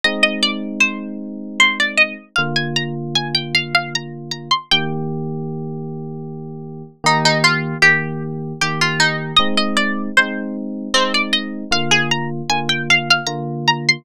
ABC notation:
X:1
M:3/4
L:1/16
Q:1/4=77
K:Eb
V:1 name="Harpsichord"
e e d2 c4 c d e2 | f a b z a g f f b2 b c' | g8 z4 | E E F2 G4 G F E2 |
e e d2 c2 z2 C d e2 | f A b z a g f f b2 b c' |]
V:2 name="Electric Piano 1"
[A,CE]12 | [D,B,F]12 | [E,B,G]12 | [E,B,G]4 [E,B,G]4 [E,B,G]4 |
[A,CE]4 [A,CE]4 [A,CE]4 | [D,B,F]4 [D,B,F]4 [D,B,F]4 |]